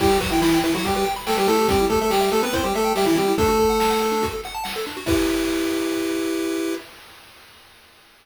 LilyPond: <<
  \new Staff \with { instrumentName = "Lead 1 (square)" } { \time 4/4 \key e \minor \tempo 4 = 142 <g g'>8 <fis fis'>16 <e e'>16 <e e'>8 <e e'>16 <fis fis'>16 <g g'>16 <g g'>16 r8 <a a'>16 <g g'>16 <a a'>8 | <g g'>8 <a a'>16 <a a'>16 <g g'>8 <a a'>16 <b b'>16 <c' c''>16 <g g'>16 <a a'>8 <g g'>16 <e e'>16 <g g'>8 | <a a'>2~ <a a'>8 r4. | e'1 | }
  \new Staff \with { instrumentName = "Lead 1 (square)" } { \time 4/4 \key e \minor e'16 g'16 b'16 g''16 b''16 g''16 b'16 e'16 g'16 b'16 g''16 b''16 g''16 b'16 e'16 g'16 | c'16 e'16 g'16 e''16 g''16 e''16 g'16 c'16 e'16 g'16 e''16 g''16 e''16 g'16 c'16 e'16 | d'16 fis'16 a'16 fis''16 a''16 fis''16 a'16 d'16 fis'16 a'16 fis''16 a''16 fis''16 a'16 d'16 fis'16 | <e' g' b'>1 | }
  \new DrumStaff \with { instrumentName = "Drums" } \drummode { \time 4/4 <cymc bd>8 <hh bd>8 sn8 hh8 <hh bd>8 hh8 sn8 hho8 | <hh bd>8 <hh bd>8 sn8 hh8 <hh bd>8 hh8 sn8 hh8 | <hh bd>8 <hh bd>8 sn8 hh8 <hh bd>8 hh8 sn8 hh8 | <cymc bd>4 r4 r4 r4 | }
>>